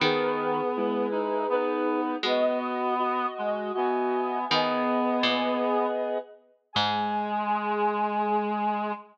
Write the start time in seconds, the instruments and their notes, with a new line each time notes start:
0.00 clarinet D#3 B3, harpsichord D#3, ocarina G#4 B4
0.77 clarinet G#3 E4
1.11 clarinet D#4
1.50 clarinet B3 D#4 B4
2.23 harpsichord G#3, clarinet B3 F#4 D#5
2.27 ocarina B4 D#5
2.99 clarinet F#4 D#5
3.38 clarinet G#3
3.74 clarinet B3 F#4 D#5, ocarina E5 G#5
4.50 harpsichord D#3, clarinet B3 G#4, ocarina B4 D#5
5.23 harpsichord A#2
6.73 harpsichord G#2, clarinet G#3 G#4, ocarina G#5